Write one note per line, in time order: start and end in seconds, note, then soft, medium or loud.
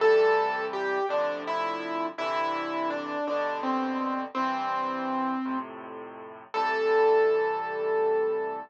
0.00 0.98 A2 loud
0.00 0.98 C3 loud
0.00 0.98 E3 loud
0.00 0.98 G3 loud
0.00 0.65 A4 loud
0.73 1.05 G4 medium
1.09 2.07 A2 loud
1.09 2.07 C3 loud
1.09 2.07 D3 loud
1.09 2.07 F3 loud
1.09 1.40 D4 medium
1.47 2.06 E4 loud
2.18 3.16 G2 loud
2.18 3.16 C3 loud
2.18 3.16 D3 loud
2.18 3.16 E3 loud
2.18 2.89 E4 loud
2.90 3.24 D4 medium
3.27 4.25 G2 loud
3.27 4.25 B2 loud
3.27 4.25 D3 loud
3.27 3.60 D4 medium
3.63 4.22 C4 medium
4.35 5.34 C2 loud
4.35 5.34 G2 loud
4.35 5.34 E3 loud
4.35 5.57 C4 loud
5.45 6.43 F2 loud
5.45 6.43 A2 loud
5.45 6.43 C3 loud
6.54 8.59 A2 loud
6.54 8.59 C3 loud
6.54 8.59 E3 loud
6.54 8.59 G3 loud
6.54 8.59 A4 loud